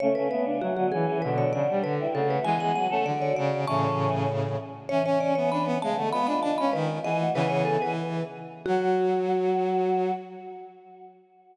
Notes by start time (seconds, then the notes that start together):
0.00 C#3 A3 C#4 C#5
0.15 C#3 A3 B4
0.30 C#3 A3 B3 B4
0.45 D4
0.61 F#3 F#4
0.77 D3 B3 F#4
0.92 E3 C#4 G#4
1.06 E3 C#4
1.22 B2 D3 F#3 D4 B4
1.37 F#3 D4 C#5
1.52 C#3 F#3 D4 D5
1.70 G3
1.83 D3 B4
2.00 G3 E4
2.14 C#3 A3 F#4 A4
2.30 A3 F#4 B4
2.44 E3 G#3 B3 G#4 G#5
2.60 B3 G#4 F#5
2.75 F#3 F#5
2.90 A3 C#4 A4
3.05 D3 F#4 D5
3.22 C#5
3.36 C#3 D5
3.67 A2 C#3 E3 C#4 A5 C#6
4.89 E3 C#4 C#5
5.05 C#4 C#5
5.20 C#4 D5
5.35 B3 C#5
5.52 D4 B5
5.65 B3
5.82 C#3 G#3 A3 A5
5.96 D3 A3 B3
6.12 G#3 B3 F4 B5
6.27 D4 B5
6.42 D4 A5
6.58 C#4 B5
6.73 D#3 B4
7.04 E3 B3 G#4 D#5
7.19 A3 F#4
7.34 C#3 E3 B3 G#4 B4
7.50 C#5
7.65 A4
7.82 E3 B4
8.66 F#3 F#4